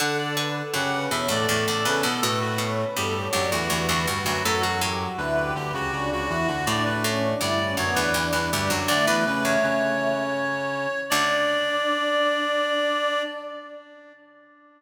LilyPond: <<
  \new Staff \with { instrumentName = "Clarinet" } { \time 3/4 \key d \major \tempo 4 = 81 fis''16 d''16 r8 fis''8 e''16 d''8 d''16 b'16 a'16 | a'16 fis'16 r8 g'8 g'16 fis'8 fis'16 fis'16 fis'16 | a'16 fis'16 r8 b'8 g'16 fis'8 fis'16 fis'16 fis'16 | d''16 b'16 r8 d''8 cis''16 b'8 b'16 g'16 fis'16 |
d''16 b'16 b'16 cis''2~ cis''16 | d''2. | }
  \new Staff \with { instrumentName = "Choir Aahs" } { \time 3/4 \key d \major a'16 a'16 b'16 a'16 g'16 b'16 cis''16 a'16 a'16 a'16 a'16 a'16 | b'16 b'16 cis''16 b'16 a'16 cis''16 d''16 b'16 b'16 b'16 b'16 b'16 | fis'16 fis'16 g'16 fis'16 e'16 g'16 b'16 g'16 d'16 d'16 e'16 fis'16 | d'16 d'16 cis'16 d'16 e'16 cis'16 b16 d'16 d'16 d'16 d'16 d'16 |
a16 a16 a4. r4 | d'2. | }
  \new Staff \with { instrumentName = "Brass Section" } { \time 3/4 \key d \major <d d'>4 <cis cis'>8 <b, b>16 <a, a>16 <a, a>16 <a, a>16 <cis cis'>16 <b, b>16 | <a, a>4 <g, g>8 <fis, fis>16 <e, e>16 <e, e>16 <e, e>16 <g, g>16 <fis, fis>16 | <fis, fis>4 <d, d>8 <d, d>16 <cis, cis>16 <cis, cis>16 <cis, cis>16 <e, e>16 <d, d>16 | <a, a>4 <g, g>8 <fis, fis>16 <e, e>16 <e, e>16 <e, e>16 <g, g>16 <fis, fis>16 |
<d d'>16 <e e'>16 <cis cis'>8 <cis cis'>2 | d'2. | }
  \new Staff \with { instrumentName = "Pizzicato Strings" } { \clef bass \time 3/4 \key d \major d8 d8 fis,8 e,16 e,16 e,16 e,16 e,16 e,16 | b,8 b,8 e,8 d,16 d,16 d,16 d,16 d,16 d,16 | a,16 b,16 a,4. r4 | a,8 a,8 d,8 d,16 d,16 d,16 d,16 d,16 d,16 |
d,16 e,8 e,8. r4. | d,2. | }
>>